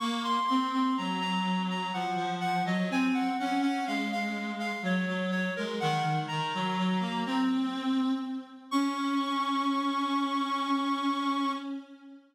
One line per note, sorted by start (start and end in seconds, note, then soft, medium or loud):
0.00 0.39 A#3 loud
0.00 0.23 C#6 medium
0.24 0.46 C6 medium
0.47 0.72 C4 loud
0.47 0.70 C6 medium
0.73 0.96 C4 loud
0.73 0.96 C6 medium
0.98 1.91 F#3 loud
0.98 1.20 A#5 medium
1.21 1.63 A#5 medium
1.70 1.93 A#5 medium
1.93 2.16 F3 medium
1.93 2.33 F#5 medium
2.16 2.63 F3 loud
2.41 2.64 F#5 medium
2.65 2.88 F#3 loud
2.65 2.90 D#5 medium
2.90 3.29 C4 loud
2.90 3.15 G#5 medium
3.14 3.37 F#5 medium
3.39 3.61 C#4 loud
3.39 3.61 F#5 medium
3.62 3.85 C#4 loud
3.62 3.85 F#5 medium
3.87 4.72 G#3 medium
3.87 4.10 F5 medium
4.12 4.51 F5 medium
4.59 4.82 F5 medium
4.82 5.05 F#3 loud
4.82 5.26 C#5 medium
5.08 5.50 F#3 loud
5.31 5.54 C#5 medium
5.56 5.81 G#3 medium
5.56 5.79 A#4 medium
5.80 6.03 D#3 loud
5.80 6.19 F#5 medium
6.03 6.26 D#3 medium
6.28 6.53 D#3 loud
6.28 7.45 A#5 medium
6.54 6.77 F#3 loud
6.78 7.01 F#3 loud
7.01 7.24 A#3 loud
7.26 8.12 C4 loud
8.71 11.52 C#4 loud
8.71 11.52 C#6 loud